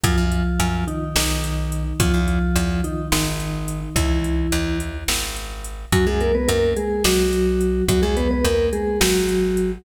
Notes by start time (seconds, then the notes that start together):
0.04 F#2 F3 F4, kick, closed hi-hat
0.18 F#2
0.32 closed hi-hat
0.60 F#2, closed hi-hat
0.87 D#3 D#4, closed hi-hat
1.15 B1 D#3 D#4, snare
1.44 closed hi-hat
1.72 closed hi-hat
2.00 E2 F3 F4, kick, closed hi-hat
2.14 E2
2.28 closed hi-hat
2.56 E2, closed hi-hat
2.84 D#3 D#4, closed hi-hat
3.12 G#1 D#3 D#4, snare
3.40 closed hi-hat
3.68 closed hi-hat
3.96 C#2 E3 E4, kick, closed hi-hat
4.24 closed hi-hat
4.52 D#2, closed hi-hat
4.80 closed hi-hat
5.08 G#1, snare
5.36 closed hi-hat
5.64 closed hi-hat
5.92 F#2 F#3 F#4, kick, closed hi-hat
6.07 F#2 G#3 G#4
6.20 A#3 A#4, closed hi-hat
6.35 B3 B4
6.48 F#2 A#3 A#4, closed hi-hat
6.76 G#3 G#4, closed hi-hat
7.04 B1 F#3 F#4, snare
7.33 closed hi-hat
7.61 closed hi-hat
7.88 E2 F#3 F#4, kick, closed hi-hat
8.02 E2 G#3 G#4
8.17 B3 B4, closed hi-hat
8.31 B3 B4
8.44 E2 A#3 A#4, closed hi-hat
8.73 G#3 G#4, closed hi-hat
9.01 G#1 F#3 F#4, snare
9.29 closed hi-hat
9.57 closed hi-hat